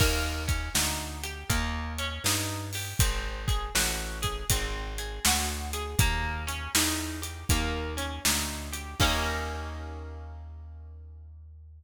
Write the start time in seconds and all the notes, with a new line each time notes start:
0.00 D#2 A#3, kick, crash
0.48 C#4, kick, closed hi-hat
0.75 D2 D#4, snare
1.23 G4, closed hi-hat
1.50 D#2 A#3, kick, closed hi-hat
1.98 C#4, closed hi-hat
2.24 G2 D#4, snare
2.73 G4, open hi-hat
2.99 G#1 C4, kick, closed hi-hat
3.48 G#4, kick, closed hi-hat
3.75 A1 F#4, snare
4.22 G#4, kick, closed hi-hat
4.50 G#1 C4, kick, closed hi-hat
4.98 G#4, closed hi-hat
5.25 D2 F#4, snare
5.73 G#4, closed hi-hat
5.99 D#2 A#3, kick, closed hi-hat
6.47 C#4, closed hi-hat
6.75 E2 D#4, snare
7.22 G4, closed hi-hat
7.49 D#2 A#3, kick, closed hi-hat
7.97 C#4, closed hi-hat
8.25 D2 D#4, snare
8.72 G4, closed hi-hat
9.00 D#2 A#3 C#4 D#4 G4, kick, crash